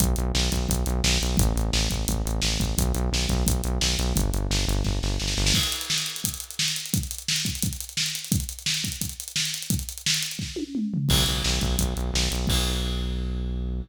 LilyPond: <<
  \new Staff \with { instrumentName = "Synth Bass 1" } { \clef bass \time 4/4 \key b \phrygian \tempo 4 = 173 b,,8 b,,8 b,,8 b,,8 b,,8 b,,8 b,,8 b,,8 | a,,8 a,,8 a,,8 a,,8 a,,8 a,,8 a,,8 a,,8 | b,,8 b,,8 b,,8 b,,8 b,,8 b,,8 b,,8 b,,8 | g,,8 g,,8 g,,8 g,,8 g,,8 g,,8 g,,8 g,,8 |
r1 | r1 | r1 | r1 |
b,,8 b,,8 b,,8 b,,8 b,,8 b,,8 b,,8 b,,8 | b,,1 | }
  \new DrumStaff \with { instrumentName = "Drums" } \drummode { \time 4/4 <hh bd>8 hh8 sn8 <hh bd>8 <hh bd>8 hh8 sn8 hh8 | <hh bd>8 hh8 sn8 <hh bd>8 <hh bd>8 hh8 sn8 <hh bd>8 | <hh bd>8 hh8 sn8 <hh bd>8 <hh bd>8 hh8 sn8 hh8 | <hh bd>8 hh8 sn8 hh8 <bd sn>8 sn8 sn16 sn16 sn16 sn16 |
<cymc bd>16 hh16 hh16 hh16 sn16 hh16 hh16 hh16 <hh bd>16 hh16 hh16 hh16 sn16 hh16 hh16 hh16 | <hh bd>16 hh16 hh16 hh16 sn16 hh16 <hh bd>16 hh16 <hh bd>16 hh16 hh16 hh16 sn16 hh16 hh16 hh16 | <hh bd>16 hh16 hh16 hh16 sn16 hh16 <hh bd>16 hh16 <hh bd>16 hh16 hh16 hh16 sn16 hh16 hh16 hh16 | <hh bd>16 hh16 hh16 hh16 sn16 hh16 hh16 hh16 <bd sn>8 tommh8 toml8 tomfh8 |
<cymc bd>8 hh8 sn8 <hh bd>8 <hh bd>8 hh8 sn8 hh8 | <cymc bd>4 r4 r4 r4 | }
>>